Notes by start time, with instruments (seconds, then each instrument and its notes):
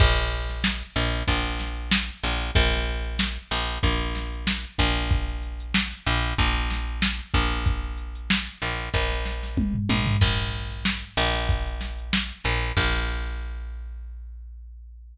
0.00 electric bass (finger) A#1, kick, crash
0.17 closed hi-hat
0.32 closed hi-hat
0.49 snare, closed hi-hat
0.64 snare
0.81 closed hi-hat
0.96 electric bass (finger) A#1, closed hi-hat
1.13 closed hi-hat
1.28 electric bass (finger) A#1, kick, closed hi-hat
1.45 closed hi-hat
1.59 snare, closed hi-hat
1.77 closed hi-hat
1.91 snare
2.09 closed hi-hat
2.23 electric bass (finger) A#1, closed hi-hat
2.41 closed hi-hat
2.55 electric bass (finger) A#1, kick, closed hi-hat
2.73 snare, closed hi-hat
2.87 closed hi-hat
3.04 closed hi-hat
3.19 snare
3.36 closed hi-hat
3.51 electric bass (finger) A#1, snare, closed hi-hat
3.69 closed hi-hat
3.83 electric bass (finger) A#1, kick, closed hi-hat
4.00 closed hi-hat
4.15 snare, closed hi-hat
4.32 closed hi-hat
4.47 snare
4.64 closed hi-hat
4.78 electric bass (finger) A#1, kick, closed hi-hat
4.96 closed hi-hat
5.11 kick, closed hi-hat
5.28 closed hi-hat
5.43 closed hi-hat
5.60 closed hi-hat
5.74 snare
5.92 closed hi-hat
6.06 electric bass (finger) A#1, closed hi-hat
6.24 closed hi-hat
6.38 electric bass (finger) A#1, kick, closed hi-hat
6.55 closed hi-hat
6.70 snare, closed hi-hat
6.88 closed hi-hat
7.02 snare
7.19 closed hi-hat
7.34 electric bass (finger) A#1, kick, closed hi-hat
7.51 closed hi-hat
7.66 kick, closed hi-hat
7.84 closed hi-hat
7.97 closed hi-hat
8.15 closed hi-hat
8.30 snare
8.47 closed hi-hat
8.61 electric bass (finger) A#1, closed hi-hat
8.79 closed hi-hat
8.93 electric bass (finger) A#1, kick, closed hi-hat
9.11 snare, closed hi-hat
9.25 snare, closed hi-hat
9.43 snare, closed hi-hat
9.57 kick, high tom
9.74 floor tom
9.89 electric bass (finger) A#1, high tom
10.07 floor tom
10.21 electric bass (finger) A#1, kick, crash
10.39 closed hi-hat
10.53 closed hi-hat
10.71 closed hi-hat
10.85 snare
11.03 closed hi-hat
11.17 electric bass (finger) A#1, closed hi-hat
11.34 snare, closed hi-hat
11.49 kick, closed hi-hat
11.67 closed hi-hat
11.81 snare, closed hi-hat
11.98 closed hi-hat
12.13 snare
12.30 closed hi-hat
12.44 electric bass (finger) A#1, snare, closed hi-hat
12.62 closed hi-hat
12.77 electric bass (finger) A#1, kick, crash